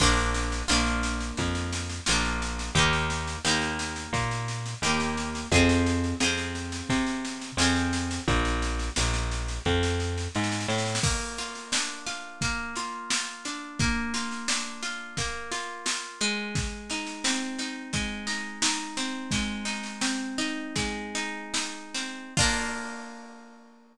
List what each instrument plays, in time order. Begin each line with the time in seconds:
0.00 electric bass (finger) A#1, orchestral harp A#3 D4 F4, kick, snare, crash
0.17 snare
0.34 snare
0.52 snare
0.68 electric bass (finger) A#1, orchestral harp A#3 D4 F4, snare
0.86 snare
1.03 snare
1.21 snare
1.37 electric bass (finger) F2, kick, snare
1.55 snare
1.73 snare
1.90 snare
2.06 electric bass (finger) A#1, orchestral harp D4 F4, snare
2.11 orchestral harp A#3
2.25 snare
2.42 snare
2.59 snare
2.75 electric bass (finger) D#2, orchestral harp A#3 D#4 G4, kick, snare
2.93 snare
3.10 snare
3.27 snare
3.45 electric bass (finger) D#2, orchestral harp A#3 D#4 G4, snare
3.62 snare
3.79 snare
3.96 snare
4.13 electric bass (finger) A#2, kick, snare
4.31 snare
4.48 snare
4.66 snare
4.82 electric bass (finger) D#2, orchestral harp D#4 G4, snare
4.86 orchestral harp A#3
5.00 snare
5.17 snare
5.35 snare
5.52 electric bass (finger) F2, orchestral harp F4 G#4, kick, snare
5.56 orchestral harp C4
5.69 snare
5.86 snare
6.04 snare
6.20 electric bass (finger) F2, orchestral harp F4 G#4, snare
6.24 orchestral harp C4
6.37 snare
6.55 snare
6.72 snare
6.89 electric bass (finger) C3, kick, snare
7.06 snare
7.25 snare
7.41 snare
7.57 electric bass (finger) F2, orchestral harp F4 G#4, snare
7.62 orchestral harp C4
7.76 snare
7.93 snare
8.11 snare
8.28 electric bass (finger) A#1, kick, snare
8.45 snare
8.62 snare
8.79 snare
8.96 electric bass (finger) A#1, snare
9.14 snare
9.31 snare
9.48 snare
9.65 electric bass (finger) F2, kick, snare
9.83 snare
10.00 snare
10.18 snare
10.35 electric bass (finger) G#2, snare
10.44 snare
10.52 snare
10.60 snare
10.68 electric bass (finger) A2, snare
10.78 snare
10.86 snare
10.95 snare
11.03 orchestral harp A#3, kick, snare, crash
11.38 orchestral harp F4, snare
11.55 snare
11.72 orchestral harp D4, snare
12.06 orchestral harp F4, snare
12.41 orchestral harp A#3, kick, snare
12.76 orchestral harp F4, snare
13.10 orchestral harp F4, snare
13.45 orchestral harp D4, snare
13.79 orchestral harp A#3, kick, snare
14.14 orchestral harp F4, snare
14.31 snare
14.48 orchestral harp D4, snare
14.83 orchestral harp F4, snare
15.17 orchestral harp A#3, kick, snare
15.52 orchestral harp F4, snare
15.86 orchestral harp F4, snare
16.21 orchestral harp G#3, snare
16.55 kick, snare
16.90 orchestral harp D#4, snare
17.06 snare
17.24 orchestral harp C4, snare
17.59 orchestral harp D#4, snare
17.93 orchestral harp G#3, kick, snare
18.27 orchestral harp D#4, snare
18.62 orchestral harp D#4, snare
18.97 orchestral harp C4, snare
19.31 orchestral harp G#3, kick, snare
19.65 orchestral harp D#4, snare
19.83 snare
20.01 orchestral harp C4, snare
20.38 orchestral harp D#4, snare
20.76 orchestral harp G#3, kick, snare
21.15 orchestral harp D#4, snare
21.54 orchestral harp D#4, snare
21.94 orchestral harp C4, snare
22.37 orchestral harp A#3 D4 F4, kick, crash